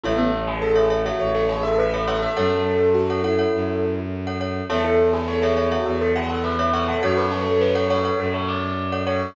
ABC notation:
X:1
M:4/4
L:1/16
Q:1/4=103
K:A
V:1 name="Tubular Bells"
A A2 G A G2 F z A G A B B A A | A12 z4 | A A2 G A G2 F z A G A B B c A | F B A A B A c2 A c d4 c2 |]
V:2 name="Acoustic Grand Piano"
E B, z2 A4 c2 c e e2 f e | A4 F2 E6 z4 | A E z2 c4 e2 f f e2 f f | c16 |]
V:3 name="Glockenspiel"
[Ace]5 [Ace] [Ace] [Ace]6 [Ace] [Ace]2 | [Acf]5 [Acf] [Acf] [Acf]6 [Acf] [Acf]2 | [Ace]5 [Ace] [Ace] [Ace]6 [Ace] [Ace]2 | [Acf]5 [Acf] [Acf] [Acf]6 [Acf] [Acf]2 |]
V:4 name="Violin" clef=bass
A,,,8 A,,,8 | F,,8 F,,8 | E,,8 E,,8 | F,,8 F,,8 |]